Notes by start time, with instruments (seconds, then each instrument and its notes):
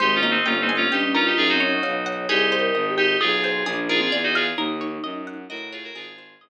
0.00 violin G#1, vibraphone G#3, electric piano 2 D#4 G4, orchestral harp C5
0.15 electric piano 2 C#4 F4
0.23 vibraphone A#3, orchestral harp D#5
0.31 electric piano 2 C4 D#4
0.45 violin G1, electric piano 2 C#4 F4, orchestral harp G5
0.61 electric piano 2 C4 D#4
0.69 orchestral harp G#5
0.76 electric piano 2 C#4 F4
0.91 violin G2, vibraphone C#4, electric piano 2 D#4 G4, orchestral harp G5
1.03 vibraphone C#4
1.14 electric piano 2 C#4 F4, vibraphone D#4, orchestral harp A#4
1.26 electric piano 2 D#4 G4, vibraphone F4
1.37 violin F#2, vibraphone D#4, electric piano 2 F4 G#4
1.49 electric piano 2 D#4 F#4
1.53 vibraphone C4
1.60 orchestral harp C#5
1.68 vibraphone D#4
1.83 violin B1, vibraphone C#5, orchestral harp F5
2.06 orchestral harp F#5
2.29 violin C2, electric piano 2 D#4 G4, orchestral harp G#4, vibraphone G#4
2.52 orchestral harp C5
2.60 vibraphone A#4
2.74 violin G#1, orchestral harp D#5
2.90 vibraphone G4
2.98 electric piano 2 D#4 G4, orchestral harp G5
3.20 violin B1, electric piano 2 F4 G#4, vibraphone G#4, orchestral harp D#5
3.44 orchestral harp C5
3.65 violin A#1, vibraphone D4, orchestral harp G#4
3.89 vibraphone D#4, electric piano 2 F4 G#4, orchestral harp A#4
4.01 vibraphone C4, electric piano 2 F4 G#4
4.11 violin E2, orchestral harp D5
4.23 electric piano 2 D#4 F#4
4.35 electric piano 2 F4 G#4, orchestral harp F5
4.57 violin D#2, vibraphone D#4, orchestral harp A#4
4.81 orchestral harp C#5
5.03 violin F#2, orchestral harp D#5
5.27 orchestral harp F#5
5.49 violin A2, electric piano 2 F#4 A#4, orchestral harp D#5
5.73 electric piano 2 F4 G#4, orchestral harp C#5
5.84 electric piano 2 F#4 A#4
5.94 violin G#1, electric piano 2 F4 G#4, orchestral harp G#4
6.18 orchestral harp C5
6.41 violin G1, orchestral harp D#5